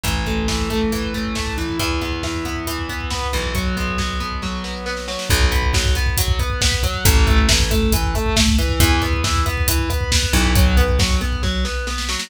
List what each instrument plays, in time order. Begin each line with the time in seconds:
0.03 electric bass (finger) A1, overdriven guitar E3, kick, closed hi-hat
0.16 kick
0.26 overdriven guitar A3, kick, closed hi-hat
0.38 kick
0.48 overdriven guitar E3, kick, snare
0.59 kick
0.70 overdriven guitar A3, kick, closed hi-hat
0.81 kick
0.92 overdriven guitar E3, kick, closed hi-hat
1.03 kick
1.14 overdriven guitar A3, kick, closed hi-hat
1.25 kick
1.35 overdriven guitar A3, kick, snare
1.47 kick
1.58 overdriven guitar E3, kick, closed hi-hat
1.69 kick
1.79 electric bass (finger) E2, overdriven guitar E3, kick, closed hi-hat
1.91 kick
2.01 overdriven guitar B3, kick, closed hi-hat
2.12 kick
2.23 overdriven guitar E3, kick, snare
2.34 kick
2.45 overdriven guitar B3, kick, closed hi-hat
2.56 kick
2.67 overdriven guitar E3, kick, closed hi-hat
2.78 kick
2.89 overdriven guitar B3, kick, closed hi-hat
3.00 kick
3.10 overdriven guitar B3, kick, snare
3.22 kick
3.32 electric bass (finger) B1, overdriven guitar E3, kick, closed hi-hat
3.44 kick
3.55 overdriven guitar F#3, kick, closed hi-hat
3.66 kick
3.77 overdriven guitar B3, kick, closed hi-hat
3.87 kick
3.98 overdriven guitar F#3, kick, snare
4.09 kick
4.20 overdriven guitar B3, kick, closed hi-hat
4.31 kick
4.42 overdriven guitar F#3, kick, snare
4.64 overdriven guitar B3, snare
4.86 overdriven guitar B3, snare
4.97 snare
5.08 overdriven guitar F#3, snare
5.19 snare
5.29 electric bass (finger) B1, overdriven guitar F#3, kick, closed hi-hat
5.41 kick
5.51 overdriven guitar B3, kick, closed hi-hat
5.62 kick
5.73 overdriven guitar F#3, kick, snare
5.85 kick
5.95 overdriven guitar B3, kick, closed hi-hat
6.06 kick
6.17 overdriven guitar F#3, kick, closed hi-hat
6.28 kick
6.39 overdriven guitar B3, kick, closed hi-hat
6.50 kick
6.61 overdriven guitar B3, kick, snare
6.72 kick
6.83 overdriven guitar F#3, kick, closed hi-hat
6.94 kick
7.05 electric bass (finger) A1, overdriven guitar E3, kick, closed hi-hat
7.16 kick
7.27 overdriven guitar A3, kick, closed hi-hat
7.38 kick
7.49 overdriven guitar E3, kick, snare
7.60 kick
7.71 overdriven guitar A3, kick, closed hi-hat
7.82 kick
7.92 overdriven guitar E3, kick, closed hi-hat
8.04 kick
8.15 overdriven guitar A3, kick, closed hi-hat
8.26 kick
8.36 overdriven guitar A3, kick, snare
8.48 kick
8.58 overdriven guitar E3, kick, closed hi-hat
8.69 kick
8.80 electric bass (finger) E2, overdriven guitar E3, kick, closed hi-hat
8.91 kick
9.02 overdriven guitar B3, kick, closed hi-hat
9.13 kick
9.24 overdriven guitar E3, kick, snare
9.35 kick
9.46 overdriven guitar B3, kick, closed hi-hat
9.57 kick
9.68 overdriven guitar E3, kick, closed hi-hat
9.79 kick
9.90 overdriven guitar B3, kick, closed hi-hat
10.01 kick
10.12 overdriven guitar B3, kick, snare
10.23 kick
10.33 electric bass (finger) B1, overdriven guitar E3, kick, closed hi-hat
10.45 kick
10.55 overdriven guitar F#3, kick, closed hi-hat
10.66 kick
10.77 overdriven guitar B3, kick, closed hi-hat
10.88 kick
10.99 overdriven guitar F#3, kick, snare
11.10 kick
11.21 overdriven guitar B3, kick, closed hi-hat
11.32 kick
11.43 overdriven guitar F#3, kick, snare
11.65 overdriven guitar B3, snare
11.87 overdriven guitar B3, snare
11.98 snare
12.09 overdriven guitar F#3, snare
12.19 snare